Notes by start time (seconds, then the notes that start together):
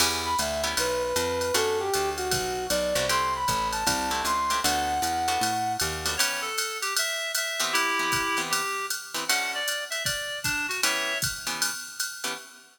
0.00 E2 B3 C#4 E4 G4, crash, ride
0.25 B5
0.39 D2 E5, hi-hat pedal, ride
0.64 B3 C#4 E4 G4, ride
0.77 B1 B4, ride
1.04 B4
1.16 F2, hi-hat pedal, ride
1.41 ride
1.54 F#2 A3 B3 D4 F#4 A4, ride
1.80 G4
1.94 D2, hi-hat pedal, ride
2.17 F#4, ride
2.31 B1, kick, ride
2.70 B1 D5, hi-hat pedal, ride
2.95 C2 A3 B3 D4 F#4, ride
3.09 A3 C4 E4 G4 C6, ride
3.35 B5
3.48 A1, kick, hi-hat pedal, ride
3.72 A5, ride
3.87 C2, kick, ride
4.11 A3 C4 E4 G4
4.25 C#2 C6, hi-hat pedal, ride
4.50 A3 C4 E4 G4, ride
4.64 D2 A3 B3 D4 F#4 F#5, ride
5.02 E2, hi-hat pedal, ride
5.28 A3 B3 D4 F#4, ride
5.41 A2, ride
5.80 D#2, hi-hat pedal, ride
6.06 A3 B3 D4 F#4, ride
6.17 E3 B3 C#4 G4 C#5, ride
6.41 A4
6.58 hi-hat pedal, ride
6.82 G4, ride
6.97 E5, ride
7.35 E5, hi-hat pedal, ride
7.60 E3 B3 C4 G4, ride
7.73 E4 G4, ride
7.99 E3 B3 C4 G4
8.12 kick, hi-hat pedal, ride
8.37 E3 B3 C4 G4, ride
8.50 G4, ride
8.90 hi-hat pedal, ride
9.14 E3 B3 C4 G4, ride
9.28 D3 A3 C#4 F#4 F#5, ride
9.55 D5
9.68 hi-hat pedal, ride
9.90 E5, ride
10.04 D5, kick, ride
10.44 D4, kick, hi-hat pedal, ride
10.68 F#4, ride
10.83 E3 B3 C#4 G4 C#5 E5, ride
11.22 kick, hi-hat pedal, ride
11.47 E3 B3 C#4 G4, ride
11.62 ride
12.00 hi-hat pedal, ride
12.24 E3 B3 C#4 G4, ride